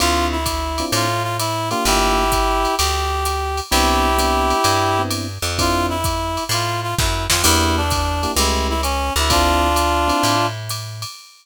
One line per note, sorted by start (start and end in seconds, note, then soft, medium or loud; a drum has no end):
0.00 0.83 D2 medium
0.00 0.37 C4 loud
0.00 0.37 D4 loud
0.00 0.37 E4 loud
0.00 0.37 F4 loud
0.00 0.27 F4 loud
0.00 ride loud
0.32 0.85 E4 medium
0.46 kick medium
0.46 hi-hat pedal loud
0.46 ride loud
0.78 1.07 C4 loud
0.78 1.07 D4 medium
0.78 1.07 E4 loud
0.78 1.07 F4 loud
0.78 ride medium
0.92 1.74 A2 medium
0.92 1.23 F4 loud
0.92 ride loud
1.23 1.37 F4 medium
1.39 1.69 E4 medium
1.39 hi-hat pedal loud
1.39 ride loud
1.70 2.24 A#3 loud
1.70 2.24 D4 loud
1.70 1.84 F4 medium
1.70 2.24 F4 loud
1.70 2.24 G4 loud
1.70 ride medium
1.85 2.67 G1 loud
1.85 2.75 E4 medium
1.85 2.75 G4 loud
1.85 ride loud
2.32 kick medium
2.32 hi-hat pedal loud
2.32 ride medium
2.65 ride medium
2.78 3.61 D2 medium
2.78 3.60 G4 medium
2.78 ride loud
3.25 hi-hat pedal loud
3.25 ride medium
3.57 ride medium
3.71 4.53 C2 loud
3.71 4.09 B3 loud
3.71 4.09 C4 loud
3.71 4.09 D4 loud
3.71 5.02 E4 loud
3.71 4.09 E4 loud
3.71 5.02 G4 loud
3.71 ride loud
4.18 4.56 B3 loud
4.18 4.56 C4 medium
4.18 4.56 D4 loud
4.18 4.56 E4 loud
4.18 hi-hat pedal loud
4.18 ride loud
4.50 ride medium
4.64 5.38 G2 medium
4.64 ride loud
4.99 5.26 B3 medium
4.99 5.26 C4 loud
4.99 5.26 D4 loud
4.99 5.26 E4 loud
5.11 hi-hat pedal medium
5.11 ride loud
5.42 6.38 F2 medium
5.42 ride medium
5.59 5.96 C4 loud
5.59 5.96 D4 loud
5.59 5.96 E4 loud
5.59 5.96 F4 loud
5.59 5.86 F4 loud
5.59 kick medium
5.59 ride loud
5.89 6.44 E4 medium
6.04 kick medium
6.04 hi-hat pedal loud
6.04 ride medium
6.37 ride medium
6.49 6.94 A2 medium
6.49 6.80 F4 medium
6.49 ride loud
6.83 6.95 F4 medium
6.98 7.27 F#2 medium
6.98 7.25 E4 medium
6.98 kick medium
6.98 snare loud
7.30 7.44 F2 medium
7.30 7.42 F4 medium
7.30 snare loud
7.43 8.26 E2 loud
7.43 7.81 A#3 loud
7.43 7.81 D4 loud
7.43 7.81 E4 loud
7.43 7.76 E4 medium
7.43 7.81 G4 loud
7.43 crash loud
7.43 ride loud
7.77 8.31 D4 medium
7.90 kick medium
7.90 hi-hat pedal medium
7.90 ride loud
8.23 8.33 A#3 loud
8.23 8.33 D4 loud
8.23 8.33 E4 loud
8.23 8.33 G4 loud
8.23 ride medium
8.36 9.10 C#2 loud
8.36 8.74 A3 loud
8.36 8.74 C#4 loud
8.36 8.74 E4 loud
8.36 8.67 E4 medium
8.36 8.74 G4 loud
8.36 ride loud
8.70 8.81 E4 medium
8.83 9.13 C#4 medium
8.83 hi-hat pedal medium
8.83 ride loud
9.16 10.12 D2 loud
9.16 9.32 E4 medium
9.16 ride medium
9.30 9.68 C4 loud
9.30 9.68 D4 loud
9.30 10.46 D4 loud
9.30 9.68 E4 loud
9.30 9.68 F4 loud
9.30 10.46 F4 loud
9.30 kick medium
9.30 ride loud
9.76 hi-hat pedal loud
9.76 ride loud
10.08 10.35 C4 loud
10.08 10.35 D4 loud
10.08 10.35 E4 loud
10.08 10.35 F4 medium
10.08 ride medium
10.23 11.05 A2 medium
10.23 ride loud
10.69 hi-hat pedal medium
10.69 ride loud
11.02 ride medium